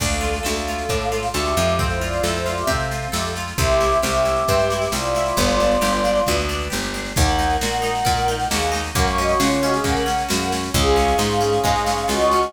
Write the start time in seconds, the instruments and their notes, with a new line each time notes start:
0.00 electric bass (finger) D2, acoustic guitar (steel) D4, choir aahs A4 F5, kick, snare, crash
0.11 snare
0.21 acoustic guitar (steel) F4, snare
0.33 snare
0.43 electric bass (finger) D2, acoustic guitar (steel) A4, choir aahs A4 F5, snare
0.56 snare
0.67 acoustic guitar (steel) F4, snare
0.79 snare
0.89 electric bass (finger) A2, acoustic guitar (steel) D4, kick, snare
1.01 snare
1.12 acoustic guitar (steel) F4, snare
1.23 snare
1.34 electric bass (finger) D2, choir aahs G4 E5, acoustic guitar (steel) A4, snare
1.46 snare
1.57 electric bass (finger) F2, acoustic guitar (steel) F4, snare
1.68 snare
1.79 acoustic guitar (steel) C4, choir aahs A4 F5, kick, snare
1.90 choir aahs E4 C5, snare
2.01 acoustic guitar (steel) F4, choir aahs F4 D5, snare
2.13 snare
2.23 electric bass (finger) F2, choir aahs E4 C5, acoustic guitar (steel) A4, snare
2.35 choir aahs E4 C5, snare
2.46 acoustic guitar (steel) F4, choir aahs F4 D5, snare
2.57 choir aahs G4 E5, snare
2.67 electric bass (finger) C3, acoustic guitar (steel) C4, choir aahs A4 F5, kick, snare
2.80 snare
2.91 acoustic guitar (steel) F4, snare
3.02 snare
3.12 electric bass (finger) F2, choir aahs G4 E5, acoustic guitar (steel) A4, snare
3.25 choir aahs A4 F5, snare
3.36 acoustic guitar (steel) F4, snare
3.47 snare
3.58 electric bass (finger) C2, acoustic guitar (steel) C4, choir aahs G4 E5, kick, snare
3.69 snare
3.81 acoustic guitar (steel) E4, snare
3.92 snare
4.03 electric bass (finger) C2, acoustic guitar (steel) G4, choir aahs G4 E5, snare
4.14 snare
4.25 acoustic guitar (steel) E4, snare
4.36 snare
4.48 electric bass (finger) G2, acoustic guitar (steel) C4, kick, snare
4.59 snare
4.70 acoustic guitar (steel) E4, snare
4.82 snare
4.92 electric bass (finger) C2, choir aahs F4 D5, acoustic guitar (steel) G4, snare
5.03 snare
5.15 acoustic guitar (steel) E4, snare
5.26 snare
5.37 electric bass (finger) G1, acoustic guitar (steel) B3, choir aahs F4 D5, kick, snare
5.49 snare
5.60 acoustic guitar (steel) D4, snare
5.71 snare
5.81 electric bass (finger) G1, acoustic guitar (steel) G4, snare
5.93 snare
6.04 acoustic guitar (steel) D4, snare
6.15 snare
6.26 electric bass (finger) D2, acoustic guitar (steel) B3, kick, snare
6.38 snare
6.49 acoustic guitar (steel) D4, snare
6.61 snare
6.70 electric bass (finger) G1, acoustic guitar (steel) G4, snare
6.83 snare
6.94 acoustic guitar (steel) D4, snare
7.05 snare
7.16 electric bass (finger) D#2, acoustic guitar (steel) A#3, choir aahs A#4 F#5, kick, snare
7.28 snare
7.39 acoustic guitar (steel) D#4, snare
7.50 snare
7.61 electric bass (finger) A#2, acoustic guitar (steel) F#4, choir aahs A#4 F#5, snare
7.73 snare
7.82 acoustic guitar (steel) D#4, snare
7.95 snare
8.05 electric bass (finger) A#2, acoustic guitar (steel) A#3, kick, snare
8.17 snare
8.28 acoustic guitar (steel) D#4, snare
8.40 snare
8.51 electric bass (finger) D#2, acoustic guitar (steel) F#4, choir aahs G#4 F5, snare
8.62 snare
8.72 acoustic guitar (steel) D#4, snare
8.85 snare
8.95 electric bass (finger) F#2, acoustic guitar (steel) A#3, choir aahs A#4 F#5, kick, snare
9.07 choir aahs F5 C#6, snare
9.18 acoustic guitar (steel) C#4, choir aahs F#4 D#5, snare
9.29 snare
9.40 electric bass (finger) C#3, choir aahs F4 C#5, acoustic guitar (steel) F#4, snare
9.51 choir aahs F4 C#5, snare
9.63 acoustic guitar (steel) C#4, choir aahs F#4 D#5, snare
9.74 choir aahs G#4 F5, snare
9.84 electric bass (finger) C#3, acoustic guitar (steel) A#3, choir aahs A#4 F#5, kick, snare
9.97 snare
10.06 acoustic guitar (steel) C#4, snare
10.18 snare
10.29 electric bass (finger) F#2, acoustic guitar (steel) F#4, choir aahs G#4 F5, snare
10.41 choir aahs A#4 F#5, snare
10.52 acoustic guitar (steel) C#4, snare
10.63 snare
10.74 electric bass (finger) C#2, acoustic guitar (steel) G#3, choir aahs G#4 F5, kick, snare
10.86 snare
10.96 acoustic guitar (steel) C#4, snare
11.08 snare
11.18 electric bass (finger) G#2, acoustic guitar (steel) F4, choir aahs G#4 F5, snare
11.31 snare
11.41 acoustic guitar (steel) C#4, snare
11.53 snare
11.64 electric bass (finger) G#2, acoustic guitar (steel) G#3, kick, snare
11.76 snare
11.86 acoustic guitar (steel) C#4, snare
11.98 snare
12.08 electric bass (finger) C#2, acoustic guitar (steel) F4, choir aahs F#4 D#5, snare
12.20 snare
12.31 acoustic guitar (steel) C#4, snare
12.43 snare